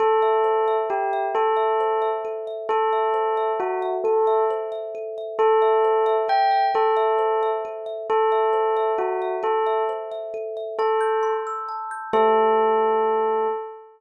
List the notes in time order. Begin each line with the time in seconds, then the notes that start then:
0.00 A4
0.22 E5
0.44 C5
0.68 E5
0.90 G4 A4
1.13 E5
1.35 A4
1.56 E5
1.80 C5
2.02 E5
2.25 A4
2.47 E5
2.69 A4
2.93 E5
3.14 C5
3.37 E5
3.60 F#4 A4
3.82 E5
4.04 A4
4.27 E5
4.50 C5
4.72 E5
4.95 A4
5.18 E5
5.39 A4
5.62 E5
5.84 C5
6.06 E5
6.28 A4 G5
6.51 E5
6.74 A4
6.97 E5
7.19 C5
7.43 E5
7.65 A4
7.86 E5
8.10 A4
8.32 E5
8.53 C5
8.77 E5
8.98 F#4 A4
9.22 E5
9.43 A4
9.66 E5
9.89 C5
10.12 E5
10.34 A4
10.57 E5
10.79 A4 A5
11.01 G6
11.23 C6
11.47 E6
11.69 A5
11.91 G6
12.13 A3 G4 A4 C5 E5